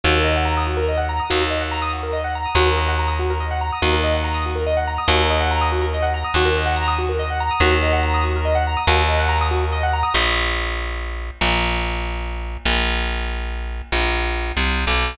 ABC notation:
X:1
M:6/8
L:1/16
Q:3/8=95
K:Ebdor
V:1 name="Acoustic Grand Piano"
G B e g b e' G B e g b e' | G B e g b e' G B e g b e' | G B e g b e' G B e g b e' | G B e g b e' G B e g b e' |
G B e g b e' G B e g b e' | G B e g b e' G B e g b e' | G B e g b e' G B e g b e' | G B e g b e' G B e g b e' |
[K:Bbdor] z12 | z12 | z12 | z12 |]
V:2 name="Electric Bass (finger)" clef=bass
E,,12 | E,,12 | E,,12 | E,,12 |
E,,12 | E,,12 | E,,12 | E,,12 |
[K:Bbdor] B,,,12 | B,,,12 | B,,,12 | B,,,6 C,,3 =B,,,3 |]